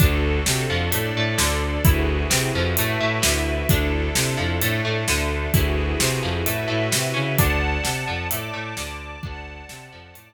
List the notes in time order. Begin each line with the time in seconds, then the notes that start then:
0.00 D2 D4 F#4 A4, kick, closed hi-hat
0.46 C3 C4, snare
0.69 F2 F3
0.92 A2 A3 D4 A4 D5, closed hi-hat
1.15 A2 A3
1.38 D2 D3, snare
1.85 D2 E4 F#4 G#4 B4, kick, closed hi-hat
2.30 C3 C4, snare
2.54 F2 F3
2.77 A2 A3 E4 F#4 B4 E5, closed hi-hat
3.00 A2 A3
3.22 D2 D3, snare
3.69 D2 D4 E4 A4, kick, closed hi-hat
4.15 C3 C4, snare
4.37 F2 F3
4.60 A2 A3 D4 A4, closed hi-hat
4.85 A2 A3
5.08 D2 D3, snare
5.53 D2 E4 F#4 G#4 B4, kick, closed hi-hat
6.00 C3 C4, snare
6.23 F2 F3
6.46 A2 A3 E4 F#4 B4 E5, closed hi-hat
6.68 A2 A3
6.92 C3 C4, snare
7.14 C#3 C#4
7.37 D2 D4 D5 F#5 A5, kick, closed hi-hat
7.84 C3 C4, snare
8.07 F2 F3
8.30 A2 A3 D5 A5 D6, closed hi-hat
8.54 A2 A3
8.77 D2 D3, snare
9.23 D2 D4 D5 F#5 A5, kick
9.69 C3 C4, snare
9.92 F2 F3
10.14 A2 A3 D5 A5 D6, closed hi-hat